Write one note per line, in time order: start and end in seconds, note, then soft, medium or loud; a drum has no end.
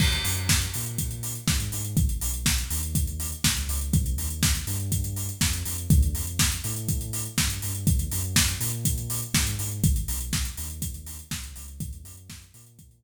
0.00 0.20 D#2 medium
0.00 kick medium
0.00 crash loud
0.12 closed hi-hat medium
0.25 0.66 F#2 medium
0.25 open hi-hat medium
0.37 closed hi-hat medium
0.49 kick medium
0.49 snare loud
0.61 closed hi-hat medium
0.74 1.38 A#2 medium
0.74 open hi-hat medium
0.86 closed hi-hat medium
0.98 kick medium
0.98 closed hi-hat medium
1.11 closed hi-hat medium
1.23 open hi-hat medium
1.35 closed hi-hat medium
1.48 1.69 G#2 medium
1.48 kick medium
1.48 snare medium
1.60 closed hi-hat medium
1.72 1.94 G#2 medium
1.72 open hi-hat medium
1.84 closed hi-hat medium
1.97 2.18 G#1 medium
1.97 kick medium
1.97 closed hi-hat medium
2.09 closed hi-hat medium
2.21 2.64 B1 medium
2.21 open hi-hat medium
2.34 closed hi-hat medium
2.46 kick medium
2.46 snare loud
2.58 closed hi-hat medium
2.70 3.33 D#2 medium
2.70 open hi-hat medium
2.83 closed hi-hat medium
2.95 kick medium
2.95 closed hi-hat medium
3.07 closed hi-hat medium
3.20 open hi-hat medium
3.32 closed hi-hat medium
3.44 3.66 C#2 medium
3.44 kick medium
3.44 snare loud
3.57 closed hi-hat medium
3.69 3.90 C#2 medium
3.69 open hi-hat medium
3.81 closed hi-hat medium
3.93 4.14 C2 loud
3.93 kick loud
3.93 closed hi-hat medium
4.06 closed hi-hat medium
4.17 4.59 D#2 medium
4.17 open hi-hat medium
4.30 closed hi-hat medium
4.43 kick medium
4.43 snare loud
4.55 closed hi-hat medium
4.67 5.30 G2 medium
4.67 open hi-hat medium
4.80 closed hi-hat medium
4.92 kick medium
4.92 closed hi-hat medium
5.04 closed hi-hat medium
5.16 open hi-hat medium
5.29 closed hi-hat medium
5.41 5.62 F2 medium
5.41 kick medium
5.41 snare medium
5.53 closed hi-hat medium
5.65 5.86 F2 medium
5.65 open hi-hat medium
5.78 closed hi-hat medium
5.90 6.11 D2 loud
5.90 kick loud
5.90 closed hi-hat medium
6.02 closed hi-hat medium
6.13 6.55 F2 medium
6.13 open hi-hat medium
6.27 closed hi-hat medium
6.39 kick medium
6.39 snare loud
6.52 closed hi-hat medium
6.64 7.27 A2 medium
6.64 open hi-hat medium
6.76 closed hi-hat medium
6.89 kick medium
6.89 closed hi-hat medium
7.01 closed hi-hat medium
7.13 open hi-hat medium
7.25 closed hi-hat medium
7.38 7.59 G2 medium
7.38 kick medium
7.38 snare medium
7.50 closed hi-hat medium
7.62 7.84 G2 medium
7.62 open hi-hat medium
7.75 closed hi-hat medium
7.87 8.08 D#2 medium
7.87 kick loud
7.87 closed hi-hat medium
7.99 closed hi-hat medium
8.11 8.54 F#2 medium
8.11 open hi-hat medium
8.24 closed hi-hat medium
8.36 kick medium
8.36 snare loud
8.48 closed hi-hat medium
8.60 9.23 A#2 medium
8.60 open hi-hat medium
8.73 closed hi-hat medium
8.85 kick medium
8.85 closed hi-hat loud
8.98 closed hi-hat medium
9.10 open hi-hat medium
9.22 closed hi-hat medium
9.34 9.55 G#2 medium
9.34 kick medium
9.34 snare loud
9.47 closed hi-hat medium
9.59 9.80 G#2 medium
9.59 open hi-hat medium
9.71 closed hi-hat medium
9.84 10.05 G#1 medium
9.84 kick loud
9.84 closed hi-hat medium
9.96 closed hi-hat medium
10.08 10.50 B1 medium
10.08 open hi-hat medium
10.20 closed hi-hat medium
10.33 kick medium
10.33 snare medium
10.45 closed hi-hat medium
10.57 11.21 D#2 medium
10.57 open hi-hat medium
10.70 closed hi-hat medium
10.82 kick medium
10.82 closed hi-hat loud
10.94 closed hi-hat medium
11.06 open hi-hat medium
11.19 closed hi-hat medium
11.31 11.53 C#2 medium
11.31 kick medium
11.31 snare medium
11.43 closed hi-hat medium
11.56 11.78 C#2 medium
11.56 open hi-hat medium
11.68 closed hi-hat medium
11.80 12.02 D#2 medium
11.80 kick loud
11.80 closed hi-hat loud
11.93 closed hi-hat medium
12.04 12.46 F#2 medium
12.04 open hi-hat medium
12.17 closed hi-hat medium
12.30 kick medium
12.30 snare medium
12.42 closed hi-hat medium
12.54 13.03 A#2 medium
12.54 open hi-hat medium
12.66 closed hi-hat medium
12.79 kick medium
12.79 closed hi-hat medium
12.91 closed hi-hat medium